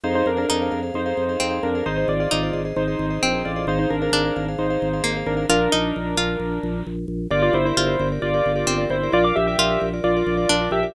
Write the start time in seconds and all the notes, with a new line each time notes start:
0.04 F2 D#4 G#4 C5 F5
0.15 D#4 C5
0.26 F2 D4 A#4
0.37 D4 G#4 A#4 C5 F5
0.49 F2 D#4 G#4 C5 F5
0.62 G#4 C5 F5
0.71 F2 G#4 C5 F5
0.83 G#4 C5 F5
0.94 F2 D#4 C5
1.06 G#4 C5 F5
1.17 F2
1.29 G#4 C5 F5
1.40 F2 C4
1.51 G#4 C5 F5
1.63 F2 D4 A#4
1.75 G#4 C5 F5
1.86 G#1 D#4 G#4 C5 D#5
1.97 D#4 C5
2.08 G#1 F4 D5
2.20 F4 G#4 C5 D5 D#5
2.31 G#1 D#4 G#4 C5 D#5
2.43 G#4 C5 D#5
2.53 G#1 G#4 C5 D#5
2.65 G#4 C5 D#5
2.76 G#1 D#4 C5
2.88 G#4 C5 D#5
2.99 G#1
3.10 G#4 C5 D#5
3.23 A#1 C4
3.34 G#4 C5 D#5
3.45 A1 F4 D5
3.56 G#4 C5 D#5
3.67 G#1 D#4 G#4 C5 F5
3.79 D#4 C5
3.90 G#1 D4 A#4
4.02 D4 G#4 A#4 C5 F5
4.12 G#1 D4 G#4 C5 F5
4.25 G#4 C5 F5
4.36 G#1 G#4 C5 F5
4.48 G#4 C5 F5
4.58 G#1 D#4 C5
4.70 G#4 C5 F5
4.82 G#1
4.93 G#4 C5 F5
5.04 G#1 A#3
5.17 G#4 C5 F5
5.26 G#1 D4 A#4
5.37 G#4 C5 F5
5.49 A#1 D4 F4 A#4
5.72 A#1 D#4
5.96 A#1
6.17 A#1 F4
6.40 A#1
6.63 A#1
6.86 A#1
7.08 A#1
7.30 G1 F4 G4 A#4 D5
7.42 F4 D5
7.53 G1 E4 C5
7.65 E4 G4 A#4 C5 D5
7.77 G1 F4 G4 A#4 D5
7.86 G4 A#4 D5
7.99 G1 G4 A#4 D5
8.12 G4 A#4 D5
8.22 G1 F4 D5
8.34 G4 A#4 D5
8.46 G1
8.56 G4 A#4 D5
8.67 G1 C4
8.78 G4 A#4 D5
8.90 G1 E4 C5
9.03 G4 A#4 D5
9.12 A#1 F4 A#4 D5
9.24 F5 D6
9.36 A#1 G4 E5
9.47 F4 G4 A#4 D5 E5
9.58 A#1 F4 A#4 D5
9.70 F4 A#4 D5
9.80 A#1 F4 A#4 D5
9.94 F4 A#4 D5
10.04 A#1 F4 D5
10.17 F4 A#4 D5
10.27 A#1
10.37 F4 A#4 D5
10.49 A#1 D4
10.61 F4 A#4 D5
10.71 A#1 G4 E5
10.83 F4 A#4 D5